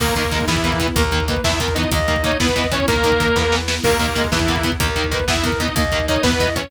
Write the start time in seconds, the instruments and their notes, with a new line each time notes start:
0.00 electric bass (finger) D#2, overdriven guitar D#3 A#3, string ensemble 1 A#3 D#4, clarinet A#3, lead 2 (sawtooth) A#3 A#4, kick, crash
0.08 kick
0.16 overdriven guitar D#3 A#3, lead 2 (sawtooth) A#3 A#4, kick, closed hi-hat
0.24 kick
0.31 overdriven guitar D#3 A#3, clarinet G#3, kick, closed hi-hat
0.41 kick
0.47 electric bass (finger) E2, lead 2 (sawtooth) E3 E4, overdriven guitar E3 B3, string ensemble 1 B3 E4, kick, snare
0.56 kick
0.63 overdriven guitar E3 B3, clarinet A#3, kick, closed hi-hat
0.72 kick
0.80 overdriven guitar E3 B3, kick, closed hi-hat
0.88 kick
0.96 electric bass (finger) D#2, overdriven guitar D#3 A#3, string ensemble 1 A#3 D#4, clarinet A#4, kick, closed hi-hat
1.04 kick
1.11 overdriven guitar D#3 A#3, kick, closed hi-hat
1.20 kick
1.28 overdriven guitar D#3 A#3, clarinet B4, kick, closed hi-hat
1.36 kick
1.44 electric bass (finger) E2, overdriven guitar E3 B3, string ensemble 1 B3 E4, lead 2 (sawtooth) E4 E5, kick, snare
1.52 kick
1.59 overdriven guitar E3 B3, clarinet A#4, kick, closed hi-hat
1.68 kick
1.75 overdriven guitar E3 B3, lead 2 (sawtooth) D#4 D#5, kick, closed hi-hat
1.83 kick
1.91 electric bass (finger) D#2, overdriven guitar D#3 A#3, string ensemble 1 A#3 D#4, clarinet D#5, kick, closed hi-hat
1.99 kick
2.08 overdriven guitar D#3 A#3, kick, closed hi-hat
2.16 kick
2.22 overdriven guitar D#3 A#3, lead 2 (sawtooth) D#4 D#5, clarinet C#5, kick, closed hi-hat
2.32 kick
2.40 electric bass (finger) E2, overdriven guitar E3 B3, string ensemble 1 B3 E4, lead 2 (sawtooth) B3 B4, kick, snare
2.49 kick
2.56 overdriven guitar E3 B3, clarinet D#5, kick, closed hi-hat
2.64 kick
2.72 overdriven guitar E3 B3, lead 2 (sawtooth) C#4 C#5, kick, closed hi-hat
2.80 kick
2.88 electric bass (finger) D#2, overdriven guitar D#3 A#3, lead 2 (sawtooth) A#3 A#4, string ensemble 1 A#3 D#4, clarinet A#4, kick, closed hi-hat
2.96 kick
3.03 overdriven guitar D#3 A#3, kick, closed hi-hat
3.12 kick
3.20 overdriven guitar D#3 A#3, kick, closed hi-hat
3.28 kick
3.36 electric bass (finger) E2, overdriven guitar E3 B3, string ensemble 1 B3 E4, kick, snare
3.52 overdriven guitar E3 B3, snare
3.68 overdriven guitar E3 B3, snare
3.84 electric bass (finger) D#2, overdriven guitar D#3 A#3, lead 2 (sawtooth) A#3 A#4, clarinet A#3, string ensemble 1 A#3 D#4, kick, crash
3.91 kick
3.99 overdriven guitar D#3 A#3, lead 2 (sawtooth) A#3 A#4, kick, closed hi-hat
4.08 kick
4.15 overdriven guitar D#3 A#3, clarinet G#3, kick, closed hi-hat
4.24 kick
4.31 electric bass (finger) E2, lead 2 (sawtooth) E3 E4, overdriven guitar E3 B3, string ensemble 1 B3 E4, kick, snare
4.39 kick
4.48 overdriven guitar E3 B3, clarinet A#3, kick, closed hi-hat
4.56 kick
4.63 overdriven guitar E3 B3, kick, closed hi-hat
4.72 kick
4.79 electric bass (finger) D#2, overdriven guitar D#3 A#3, string ensemble 1 A#3 D#4, clarinet A#4, kick, closed hi-hat
4.88 kick
4.96 overdriven guitar D#3 A#3, kick, closed hi-hat
5.04 kick
5.11 overdriven guitar D#3 A#3, clarinet B4, kick, closed hi-hat
5.19 kick
5.28 electric bass (finger) E2, overdriven guitar E3 B3, string ensemble 1 B3 E4, lead 2 (sawtooth) E4 E5, kick, snare
5.36 kick
5.43 overdriven guitar E3 B3, clarinet A#4, kick, closed hi-hat
5.52 kick
5.59 overdriven guitar E3 B3, lead 2 (sawtooth) D#4 D#5, kick, closed hi-hat
5.68 kick
5.76 electric bass (finger) D#2, overdriven guitar D#3 A#3, string ensemble 1 A#3 D#4, clarinet D#5, kick, closed hi-hat
5.85 kick
5.92 overdriven guitar D#3 A#3, kick, closed hi-hat
6.00 kick
6.08 overdriven guitar D#3 A#3, lead 2 (sawtooth) D#4 D#5, clarinet C#5, kick, closed hi-hat
6.16 kick
6.23 electric bass (finger) E2, overdriven guitar E3 B3, lead 2 (sawtooth) B3 B4, string ensemble 1 B3 E4, kick, snare
6.32 kick
6.39 overdriven guitar E3 B3, clarinet D#5, kick, closed hi-hat
6.47 kick
6.56 overdriven guitar E3 B3, lead 2 (sawtooth) C#4 C#5, kick, closed hi-hat
6.64 kick